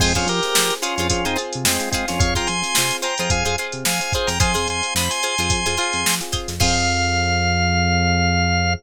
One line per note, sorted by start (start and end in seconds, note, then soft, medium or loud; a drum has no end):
0.00 0.14 F2 medium
0.00 0.13 G#3 medium
0.00 0.13 C4 medium
0.00 0.32 C4 medium
0.00 0.32 F4 medium
0.00 0.13 F4 medium
0.00 0.32 G#4 medium
0.00 0.13 G#4 loud
0.00 0.13 C5 loud
0.00 kick loud
0.00 crash loud
0.15 0.27 F2 medium
0.15 0.28 C#4 medium
0.15 0.28 F4 medium
0.15 0.48 F4 medium
0.15 0.48 G#4 medium
0.15 0.48 C5 medium
0.15 kick medium
0.15 closed hi-hat medium
0.27 0.40 F3 medium
0.27 0.74 G4 medium
0.27 0.74 A#4 medium
0.27 closed hi-hat medium
0.43 0.87 C4 medium
0.43 0.87 F4 medium
0.43 0.87 G#4 medium
0.43 snare soft
0.43 closed hi-hat medium
0.55 0.71 F3 medium
0.55 0.78 F4 medium
0.55 0.78 G#4 medium
0.55 0.78 C5 medium
0.55 snare loud
0.70 closed hi-hat medium
0.82 0.95 C#4 medium
0.82 0.95 F4 medium
0.82 0.94 F4 loud
0.82 0.94 G#4 medium
0.82 0.94 C5 medium
0.82 closed hi-hat loud
0.96 1.09 F2 medium
0.96 1.08 C#4 medium
0.96 1.08 F4 medium
0.96 1.21 G#4 medium
0.96 1.21 C5 medium
0.96 snare soft
0.96 closed hi-hat medium
1.00 1.21 F4 medium
1.10 1.25 F2 medium
1.10 1.22 C4 medium
1.10 1.25 C#4 medium
1.10 1.22 F4 medium
1.10 1.25 F4 medium
1.10 1.22 G#4 medium
1.10 kick medium
1.10 closed hi-hat loud
1.25 1.37 F2 medium
1.25 1.34 C4 medium
1.25 1.37 C4 medium
1.25 1.37 D#4 medium
1.25 1.34 F4 medium
1.25 1.35 F4 medium
1.25 1.34 G#4 medium
1.25 1.35 G#4 medium
1.25 1.35 C5 medium
1.25 closed hi-hat medium
1.36 1.72 C4 medium
1.36 1.81 F4 medium
1.36 1.72 F4 medium
1.36 1.81 G#4 medium
1.36 1.72 G#4 medium
1.36 1.81 C5 medium
1.36 closed hi-hat medium
1.53 1.66 C3 medium
1.53 closed hi-hat medium
1.64 1.78 F2 medium
1.64 1.89 G#3 medium
1.64 1.89 C4 medium
1.64 snare loud
1.80 2.13 C4 medium
1.80 2.13 F4 medium
1.80 2.13 G#4 medium
1.80 closed hi-hat medium
1.91 2.06 G#3 medium
1.91 2.06 C4 medium
1.91 2.33 F4 loud
1.91 2.33 G#4 loud
1.91 2.33 C5 medium
1.91 kick medium
1.91 closed hi-hat loud
2.08 2.21 F2 medium
2.08 2.20 C#4 medium
2.08 2.20 F4 medium
2.08 snare medium
2.08 closed hi-hat medium
2.19 2.35 F2 medium
2.19 2.54 C4 medium
2.19 2.54 F4 medium
2.19 2.54 G#4 medium
2.19 2.34 C#5 medium
2.19 2.34 F5 medium
2.19 kick loud
2.19 closed hi-hat loud
2.35 2.48 F3 medium
2.35 2.68 F4 medium
2.35 2.68 G#4 medium
2.35 2.68 C5 medium
2.35 2.48 G5 medium
2.35 2.48 A#5 medium
2.35 kick medium
2.35 snare soft
2.35 closed hi-hat medium
2.47 2.63 F2 medium
2.47 2.97 G#5 medium
2.47 2.97 C6 medium
2.47 closed hi-hat medium
2.62 3.05 C4 medium
2.62 3.05 F4 medium
2.62 3.05 G#4 medium
2.62 snare soft
2.62 closed hi-hat medium
2.75 2.91 C3 medium
2.75 3.00 F4 medium
2.75 3.00 G#4 medium
2.75 3.00 C5 medium
2.75 snare loud
2.91 closed hi-hat medium
3.02 3.14 F4 medium
3.02 3.14 G#4 medium
3.02 3.14 C5 medium
3.02 3.18 G5 medium
3.02 3.18 A#5 medium
3.02 closed hi-hat medium
3.18 3.29 F2 medium
3.18 3.41 F4 medium
3.18 3.41 G#4 medium
3.18 3.41 C5 medium
3.18 3.30 G5 medium
3.18 3.30 A#5 medium
3.18 closed hi-hat medium
3.30 3.44 F2 medium
3.30 3.43 C4 medium
3.30 3.43 F4 medium
3.30 3.43 G#4 medium
3.30 3.44 F5 medium
3.30 3.44 G#5 medium
3.30 kick loud
3.30 closed hi-hat loud
3.44 3.56 F2 medium
3.44 3.55 C4 medium
3.44 3.55 F4 medium
3.44 3.55 G#4 medium
3.44 3.55 C5 medium
3.44 3.56 F5 medium
3.44 3.56 G#5 medium
3.44 closed hi-hat medium
3.58 3.92 C4 medium
3.58 3.92 F4 medium
3.58 4.04 F4 medium
3.58 3.92 G#4 medium
3.58 4.04 G#4 medium
3.58 4.04 C5 medium
3.58 closed hi-hat medium
3.72 3.84 C3 medium
3.72 closed hi-hat medium
3.85 4.00 F2 medium
3.85 4.13 F5 medium
3.85 4.13 G#5 medium
3.85 snare loud
4.00 4.33 C4 medium
4.00 4.33 F4 medium
4.00 4.33 G#4 medium
4.00 closed hi-hat medium
4.13 4.37 F4 medium
4.13 4.29 G#4 medium
4.13 4.37 G#4 medium
4.13 4.37 C5 medium
4.13 4.29 C5 medium
4.13 kick loud
4.13 closed hi-hat medium
4.27 4.39 F2 medium
4.27 4.39 G5 medium
4.27 4.39 A#5 medium
4.27 snare medium
4.27 closed hi-hat medium
4.40 4.55 F2 medium
4.40 4.74 C4 medium
4.40 4.74 F4 medium
4.40 4.52 F4 medium
4.40 4.74 G#4 medium
4.40 4.52 G#4 medium
4.40 4.52 C5 medium
4.40 4.68 G#5 medium
4.40 4.68 C6 medium
4.40 kick loud
4.40 closed hi-hat loud
4.54 4.67 F2 medium
4.54 4.86 F4 medium
4.54 4.86 G#4 medium
4.54 4.86 C5 medium
4.54 snare soft
4.54 closed hi-hat medium
4.68 4.82 F2 medium
4.68 4.94 G#5 medium
4.68 4.94 C6 medium
4.68 closed hi-hat medium
4.83 5.25 C4 medium
4.83 5.25 F4 medium
4.83 5.25 G#4 medium
4.83 closed hi-hat medium
4.95 5.09 F2 medium
4.95 5.19 F4 medium
4.95 5.19 G#4 medium
4.95 5.19 C5 medium
4.95 5.11 B5 medium
4.95 snare loud
5.10 6.15 G#5 medium
5.10 6.15 C6 medium
5.10 closed hi-hat medium
5.23 5.35 F4 medium
5.23 5.35 G#4 medium
5.23 5.35 C5 medium
5.23 closed hi-hat medium
5.38 5.50 F2 medium
5.38 5.60 F4 medium
5.38 5.60 G#4 medium
5.38 5.60 C5 medium
5.38 closed hi-hat medium
5.50 5.65 F2 medium
5.50 5.63 C4 medium
5.50 5.63 F4 medium
5.50 5.63 G#4 medium
5.50 kick loud
5.50 closed hi-hat loud
5.66 5.78 F2 medium
5.66 5.76 C4 medium
5.66 5.76 F4 medium
5.66 5.76 G#4 medium
5.66 5.76 C5 medium
5.66 closed hi-hat medium
5.77 6.12 C4 medium
5.77 6.23 F4 medium
5.77 6.12 F4 medium
5.77 6.23 G#4 medium
5.77 6.12 G#4 medium
5.77 6.23 C5 medium
5.77 closed hi-hat medium
5.93 6.05 F2 medium
5.93 closed hi-hat medium
6.06 6.20 F3 medium
6.06 snare loud
6.21 6.53 C4 medium
6.21 6.53 F4 medium
6.21 6.53 G#4 medium
6.21 snare soft
6.21 closed hi-hat medium
6.32 6.55 F4 medium
6.32 6.55 G#4 medium
6.32 6.55 C5 medium
6.32 kick medium
6.32 closed hi-hat medium
6.48 6.59 F2 medium
6.48 snare medium
6.48 closed hi-hat medium
6.60 8.75 F2 loud
6.60 8.74 C4 loud
6.60 8.73 F4 medium
6.60 8.74 F4 medium
6.60 8.73 G#4 loud
6.60 8.74 G#4 loud
6.60 8.73 C5 loud
6.60 8.74 F5 loud
6.60 kick loud
6.60 crash loud